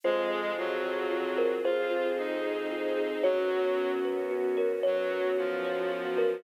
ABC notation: X:1
M:6/8
L:1/8
Q:3/8=75
K:Ebdor
V:1 name="Kalimba"
c5 B | c4 z2 | d5 B | d5 B |]
V:2 name="Violin"
A,2 G,4 | F2 E4 | G,3 z3 | G,2 F,4 |]
V:3 name="Kalimba"
F c F A F c | A F F c F A | G d G _c G d | _c G G d G c |]
V:4 name="Synth Bass 2" clef=bass
F,,6 | F,,6 | G,,6 | G,,6 |]
V:5 name="String Ensemble 1"
[CFA]6 | [CAc]6 | [_CDG]6 | [G,_CG]6 |]